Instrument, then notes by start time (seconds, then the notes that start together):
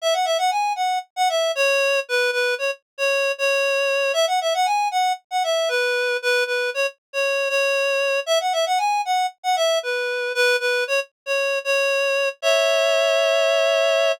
clarinet
0.02 E5
0.13 F#5
0.25 E5
0.38 F#5
0.51 G#5
0.76 F#5
1.16 F#5
1.29 E5
1.55 C#5
2.09 B4
2.33 B4
2.58 C#5
2.98 C#5
3.38 C#5
4.13 E5
4.27 F#5
4.41 E5
4.54 F#5
4.66 G#5
4.91 F#5
5.31 F#5
5.44 E5
5.69 B4
6.22 B4
6.46 B4
6.74 C#5
7.13 C#5
7.49 C#5
8.26 E5
8.40 F#5
8.53 E5
8.66 F#5
8.78 G#5
9.05 F#5
9.43 F#5
9.56 E5
9.83 B4
10.35 B4
10.60 B4
10.87 C#5
11.26 C#5
11.64 C#5
12.42 C#5 E5